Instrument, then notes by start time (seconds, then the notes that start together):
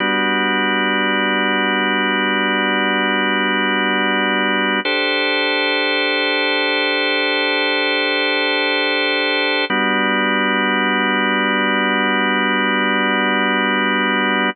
drawbar organ
0.00 G3 B3 D4 F#4
4.85 D4 G4 A4 C5
9.70 G3 B3 D4 F#4